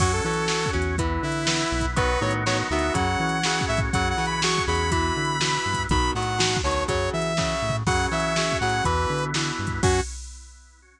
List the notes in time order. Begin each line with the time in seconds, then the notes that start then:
0.00 F#2 F#3 C#4 F#4, kick, crash
0.13 A4
0.24 E3 F#3 C#4 A4
0.33 closed hi-hat
0.48 F#3 C#4, snare
0.66 kick
0.73 E2 F#3 C#4
0.82 closed hi-hat
0.98 E3 B3 E4, kick, closed hi-hat
1.23 D3 E4
1.32 closed hi-hat
1.47 E3 B3, snare
1.72 B1
1.80 kick, closed hi-hat
1.96 D#3 F#3 B3 D#4 F#4 B4, kick, closed hi-hat
2.21 A2 D#3 F#3 B3 C#5
2.31 closed hi-hat
2.46 D#3 F#3 B3 C#5, snare
2.70 D2 D#3 F#3 B3 E5
2.79 closed hi-hat
2.94 F#2 C#3 F#3 C#4 F#4 F#5, kick, closed hi-hat
3.20 E3
3.29 closed hi-hat
3.43 C#3 F#3, snare
3.61 kick
3.68 A2 E5
3.77 kick, closed hi-hat
3.93 F#2 C#3 F#3 C#4 F#4 F#5, kick, closed hi-hat
4.10 F#5
4.18 C#3 E3 F#3
4.26 B5, closed hi-hat
4.42 C#3 F#3 C#6, snare
4.58 kick
4.67 E2 C#3 F#3 B5
4.75 closed hi-hat
4.91 B2 E3 B3 E4 B5, kick, closed hi-hat
5.16 D3
5.25 closed hi-hat
5.41 B2 E3, snare
5.66 G2
5.74 kick, closed hi-hat
5.89 B1 B2 D#3 F#3 B5, kick, closed hi-hat
6.15 A2 B2 D#3 F#3 F#5
6.22 closed hi-hat
6.38 B2 D#3 F#3, snare
6.57 kick
6.64 D2 B2 D#3 F#3 C#5
6.71 closed hi-hat
6.88 F#2 C#3 F#3 C#5, kick, closed hi-hat
7.13 E3 E5
7.22 closed hi-hat
7.37 C#3 F#3, kick, snare
7.62 A2
7.70 floor tom
7.86 F#2 C#3 F#3 C#4 F#4 F#5, kick, crash
8.11 C#3 E3 F#3 E5
8.20 closed hi-hat
8.36 C#3 F#3, snare
8.52 kick
8.61 A2 C#3 F#3 F#5
8.69 closed hi-hat
8.84 E2 B2 E3 B3 E4 B4, kick, closed hi-hat
9.10 D3
9.18 closed hi-hat
9.34 B2 E3, snare
9.59 G2
9.67 kick, closed hi-hat
9.83 F#2 F#3 C#4 F#4, kick, crash